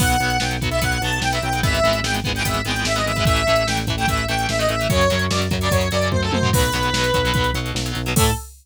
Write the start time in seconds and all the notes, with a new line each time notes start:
0.00 B1 F#3 B3 F#5, kick, crash
0.10 closed hi-hat
0.20 B1 F#3 B3, closed hi-hat
0.30 closed hi-hat
0.40 B1 F#3 B3 G5, snare
0.51 closed hi-hat
0.61 B1 F#3 B3, kick, closed hi-hat
0.71 F#3 B3 E5, closed hi-hat
0.81 B1 F#3 B3 F#5, kick, closed hi-hat
0.92 closed hi-hat
1.01 B1 F#3 B3 A5, closed hi-hat
1.13 closed hi-hat
1.21 B1 G5, snare
1.32 F#3 B3 E5, closed hi-hat
1.42 B1 G5, closed hi-hat
1.53 F#3 B3, closed hi-hat
1.63 G#1 G#3 B3 E5, kick, closed hi-hat
1.67 E3
1.74 closed hi-hat
1.84 G#1 E3 G#3 B3, closed hi-hat
1.93 closed hi-hat
2.03 G#1 G#3 B3 G5, snare
2.08 E3
2.14 closed hi-hat
2.24 G#1 G#3 B3, kick, closed hi-hat
2.29 E3
2.35 E3 G#3 B3 G5, closed hi-hat
2.45 G#1 G#3 B3 E5, kick, closed hi-hat
2.49 E3
2.54 closed hi-hat
2.65 G#1 G#3 B3 G5, closed hi-hat
2.69 E3
2.76 closed hi-hat
2.85 G#1 E5, snare
2.96 G#3 B3 D#5, closed hi-hat
3.00 E3
3.06 G#1 E5, closed hi-hat
3.16 G#3 B3, kick, closed hi-hat
3.20 E3
3.25 A1 E3 A3 E5, kick, closed hi-hat
3.36 closed hi-hat
3.47 A1 E3 A3, closed hi-hat
3.56 closed hi-hat
3.67 A1 E3 A3 G5, snare
3.77 closed hi-hat
3.87 A1 E3 A3, kick, closed hi-hat
3.97 E3 A3 G5, closed hi-hat
4.08 A1 E3 A3 E5, kick, closed hi-hat
4.17 closed hi-hat
4.28 A1 E3 A3 G5, closed hi-hat
4.39 closed hi-hat
4.49 A1 E5, snare
4.59 E3 A3 D#5, closed hi-hat
4.68 A1 E5, closed hi-hat
4.79 E3 A3, closed hi-hat
4.89 F#2 C#3 F#3 C#5, kick, closed hi-hat
5.01 closed hi-hat
5.10 F#2 C#3 F#3, closed hi-hat
5.19 closed hi-hat
5.31 F#2 C#3 F#3 D5, snare
5.42 closed hi-hat
5.51 F#2 C#3 F#3, kick, closed hi-hat
5.61 C#3 F#3 D5, closed hi-hat
5.71 F#2 C#3 F#3 C#5, kick, closed hi-hat
5.81 closed hi-hat
5.91 F#2 C#3 F#3 D5, closed hi-hat
6.02 closed hi-hat
6.11 F#2 C5, kick, high tom
6.22 C#3 F#3 A4
6.32 F#2 C5, high tom
6.42 C#3 F#3, floor tom
6.53 B1 B2 F#3 B4, kick, crash
6.63 closed hi-hat
6.72 B1 B2 F#3, closed hi-hat
6.83 closed hi-hat
6.93 B1 B2 F#3, snare
7.04 closed hi-hat
7.14 B1 B2 F#3, kick, closed hi-hat
7.25 B2 F#3, closed hi-hat
7.34 B1 B2 F#3, kick, closed hi-hat
7.44 closed hi-hat
7.54 B1 B2 F#3, closed hi-hat
7.66 closed hi-hat
7.74 B1, snare
7.86 B2 F#3, closed hi-hat
7.95 B1, closed hi-hat
8.06 B2 F#3, closed hi-hat
8.16 A2 E3 A3 A4, kick, crash